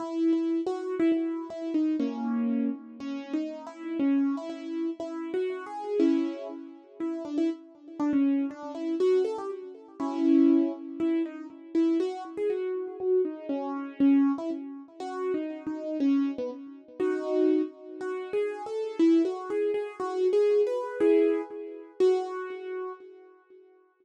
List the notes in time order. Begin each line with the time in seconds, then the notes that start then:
0.00 E4
0.33 E4
0.66 F#4
1.00 E4
1.12 E4
1.50 E4
1.74 D#4
2.00 A#3 C#4
3.00 C#4
3.33 D#4
3.67 E4
3.99 C#4
4.37 E4
4.50 E4
5.00 E4
5.34 F#4
5.66 G#4
6.00 C#4 E4
7.00 E4
7.25 D4
7.38 E4
8.00 D4
8.13 C#4
8.51 D4
8.75 E4
9.00 F#4
9.24 A4
9.38 G4
10.00 C#4 E4
11.00 E4
11.26 D#4
11.75 E4
12.00 F#4
12.37 G#4
12.50 F#4
13.00 F#4
13.25 D#4
13.49 C#4
14.00 C#4
14.38 E4
15.00 F#4
15.34 D#4
15.67 D#4
16.00 C#4
16.38 B3
17.00 D#4 F#4
18.01 F#4
18.33 G#4
18.66 A4
18.99 E4
19.25 F#4
19.50 G#4
19.74 G#4
20.00 F#4
20.33 G#4
20.67 B4
21.00 E4 G#4
22.00 F#4